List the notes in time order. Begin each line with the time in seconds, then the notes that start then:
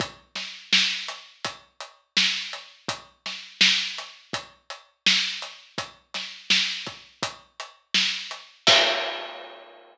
0.00 kick, closed hi-hat
0.35 snare, closed hi-hat
0.73 snare
1.08 closed hi-hat
1.45 kick, closed hi-hat
1.80 closed hi-hat
2.17 snare
2.53 closed hi-hat
2.88 kick, closed hi-hat
3.26 snare, closed hi-hat
3.61 snare
3.98 closed hi-hat
4.33 kick, closed hi-hat
4.70 closed hi-hat
5.06 snare
5.42 closed hi-hat
5.78 kick, closed hi-hat
6.14 snare, closed hi-hat
6.50 snare
6.86 kick, closed hi-hat
7.23 kick, closed hi-hat
7.60 closed hi-hat
7.94 snare
8.31 closed hi-hat
8.67 kick, crash